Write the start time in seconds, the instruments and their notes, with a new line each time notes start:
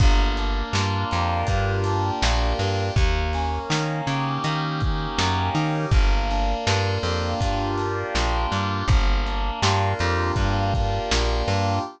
0.00 electric bass (finger) G1, electric piano 2 A#3, kick, crash
0.37 electric piano 2 D4, closed hi-hat
0.73 electric bass (finger) G2, electric piano 2 F4, snare
1.11 electric bass (finger) F2, electric piano 2 G4, closed hi-hat
1.47 electric bass (finger) G2, electric piano 2 A#3, kick, closed hi-hat
1.84 electric piano 2 D4, closed hi-hat
2.22 electric bass (finger) A#1, electric piano 2 F4, snare
2.59 electric bass (finger) G2, electric piano 2 G4, closed hi-hat
2.96 electric bass (finger) D#2, electric piano 2 A#3, kick, closed hi-hat
3.33 electric piano 2 C#4, closed hi-hat
3.70 electric bass (finger) D#3, electric piano 2 D#4, snare
4.07 electric bass (finger) C#3, electric piano 2 G4, closed hi-hat
4.44 electric bass (finger) D#3, electric piano 2 A#3, closed hi-hat
4.80 electric piano 2 C#4, kick, closed hi-hat
5.19 electric bass (finger) F#2, electric piano 2 D#4, snare
5.55 electric bass (finger) D#3, electric piano 2 G4, closed hi-hat
5.91 electric bass (finger) G1, electric piano 2 A#3, kick, closed hi-hat
6.30 electric piano 2 D4, closed hi-hat
6.66 electric bass (finger) G2, electric piano 2 F4, snare
7.03 electric bass (finger) F2, electric piano 2 G4, closed hi-hat
7.41 electric bass (finger) G2, electric piano 2 A#3, kick, closed hi-hat
7.78 electric piano 2 D4, closed hi-hat
8.15 electric bass (finger) A#1, electric piano 2 F4, snare
8.52 electric bass (finger) G2, electric piano 2 G4, closed hi-hat
8.88 electric bass (finger) G1, electric piano 2 A#3, kick, closed hi-hat
9.26 electric piano 2 D4, closed hi-hat
9.62 electric bass (finger) G2, electric piano 2 F4, snare
9.99 electric bass (finger) F2, electric piano 2 G4, closed hi-hat
10.36 electric bass (finger) G2, electric piano 2 A#3, kick, closed hi-hat
10.74 electric piano 2 D4, kick, closed hi-hat
11.11 electric bass (finger) A#1, electric piano 2 F4, snare
11.48 electric bass (finger) G2, electric piano 2 G4, closed hi-hat